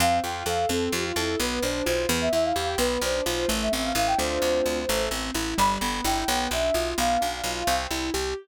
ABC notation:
X:1
M:6/8
L:1/16
Q:3/8=86
K:C
V:1 name="Ocarina"
f2 g2 f2 A2 G F E2 | B2 c2 c2 z e e f f g | B2 c2 c2 z e e f f g | c8 z4 |
b4 g4 e4 | f8 z4 |]
V:2 name="Acoustic Grand Piano"
C2 F2 A2 C2 F2 A2 | B,2 D2 F2 B,2 E2 G2 | B,2 D2 F2 A,2 C2 E2 | [A,CDF]6 A,2 C2 E2 |
G,2 B,2 E2 B,2 D2 F2 | B,2 D2 F2 C2 E2 G2 |]
V:3 name="Electric Bass (finger)" clef=bass
F,,2 F,,2 F,,2 F,,2 F,,2 F,,2 | B,,,2 B,,,2 B,,,2 E,,2 E,,2 E,,2 | B,,,2 B,,,2 B,,,2 A,,,2 A,,,2 A,,,2 | D,,2 D,,2 D,,2 A,,,2 A,,,2 A,,,2 |
G,,,2 G,,,2 G,,,2 B,,,2 B,,,2 B,,,2 | B,,,2 B,,,2 B,,,2 C,,2 C,,2 C,,2 |]